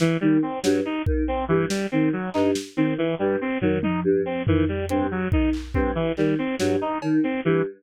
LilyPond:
<<
  \new Staff \with { instrumentName = "Choir Aahs" } { \clef bass \time 6/4 \tempo 4 = 141 r8 dis8 r8 g,8 r8 dis8 r8 g,8 r8 dis8 r8 g,8 | r8 dis8 r8 g,8 r8 dis8 r8 g,8 r8 dis8 r8 g,8 | r8 dis8 r8 g,8 r8 dis8 r8 g,8 r8 dis8 r8 g,8 | }
  \new Staff \with { instrumentName = "Lead 1 (square)" } { \time 6/4 e8 g8 c'8 fis8 dis'8 r8 c'8 e8 g8 c'8 fis8 dis'8 | r8 c'8 e8 g8 c'8 fis8 dis'8 r8 c'8 e8 g8 c'8 | fis8 dis'8 r8 c'8 e8 g8 c'8 fis8 dis'8 r8 c'8 e8 | }
  \new DrumStaff \with { instrumentName = "Drums" } \drummode { \time 6/4 sn4 r8 sn8 r8 bd8 r4 sn4 r8 hc8 | sn4 r4 r8 tomfh8 tommh4 r8 tomfh8 r8 hh8 | r8 bd8 hc8 bd8 r8 hc8 r8 sn8 r8 cb8 r4 | }
>>